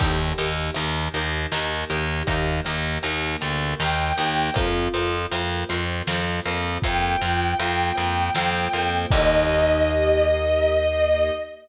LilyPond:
<<
  \new Staff \with { instrumentName = "Violin" } { \time 3/4 \key ees \lydian \tempo 4 = 79 r2. | r2 g''4 | r2. | g''2. |
ees''2. | }
  \new Staff \with { instrumentName = "Pizzicato Strings" } { \time 3/4 \key ees \lydian <ees' g' bes'>8 <ees' g' bes'>8 <ees' g' bes'>8 <ees' g' bes'>8 <ees' g' bes'>8 <ees' g' bes'>8 | <ees' g' bes'>8 <ees' g' bes'>8 <ees' g' bes'>8 <ees' g' bes'>8 <ees' g' bes'>8 <ees' g' bes'>8 | <f' bes' c''>8 <f' bes' c''>8 <f' bes' c''>8 <f' bes' c''>8 <f' bes' c''>8 <f' bes' c''>8 | <f' bes' c''>8 <f' bes' c''>8 <f' bes' c''>8 <f' bes' c''>8 <f' bes' c''>8 <f' bes' c''>8 |
<ees' g' bes'>2. | }
  \new Staff \with { instrumentName = "Electric Bass (finger)" } { \clef bass \time 3/4 \key ees \lydian ees,8 ees,8 ees,8 ees,8 ees,8 ees,8 | ees,8 ees,8 ees,8 d,8 ees,8 ees,8 | f,8 f,8 f,8 f,8 f,8 f,8 | f,8 f,8 f,8 f,8 f,8 f,8 |
ees,2. | }
  \new Staff \with { instrumentName = "String Ensemble 1" } { \time 3/4 \key ees \lydian <bes ees' g'>2. | <bes g' bes'>2. | <bes c' f'>2. | <f bes f'>2. |
<bes ees' g'>2. | }
  \new DrumStaff \with { instrumentName = "Drums" } \drummode { \time 3/4 <cymc bd>8 hh8 hh8 hh8 sn8 hh8 | <hh bd>8 hh8 hh8 hh8 sn8 hh8 | <hh bd>8 hh8 hh8 hh8 sn8 hho8 | <hh bd>8 hh8 hh8 hh8 sn8 hh8 |
<cymc bd>4 r4 r4 | }
>>